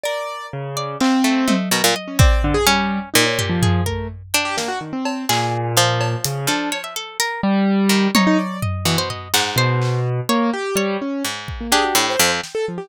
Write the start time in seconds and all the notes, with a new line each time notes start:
0.03 A#4 D5
0.53 C#3
0.77 D5
1.00 C4 F5, clap
1.24 A3
1.48 A3 D#5, high tom
1.71 B2 A#4
1.84 A#2 G3
1.96 D#5
2.08 C#4
2.19 C4 D5, kick
2.43 D3, floor tom
2.54 G#4
2.67 G3 C#4
3.14 A#2 D#4
3.26 C#5
3.39 G4, floor tom
3.49 F3
3.62 G#4, floor tom
3.86 A3 A#4, kick
4.34 D4 G5
4.45 G4
4.57 A#3, snare
4.68 F#4
4.81 D#3
4.93 C4
5.05 cowbell
5.29 A#2 G#4, clap
5.77 F3 F5
6.01 cowbell
6.24 C#3, closed hi-hat
6.47 F3 D4 A4
6.72 C#5, cowbell
6.84 E5
6.96 A4
7.20 A#4, closed hi-hat
7.43 G3
7.89 D#3
8.15 C3 D#4 C#5, high tom
8.27 D#4
8.38 D5
8.62 D#5, floor tom
8.85 B2 E3
8.98 C5
9.10 D#5, floor tom
9.34 G#2 F#5, clap
9.56 B2 C5
9.82 clap
10.29 A#3 C#5
10.53 G4
10.76 G3 C#5
11.02 C#4
11.25 G#2
11.48 kick
11.61 A#3
11.72 D4 G4 G#4
11.84 F#4
11.95 A2 D4
12.09 C5
12.19 F2 G5
12.43 snare
12.55 A4
12.68 F3
12.78 G4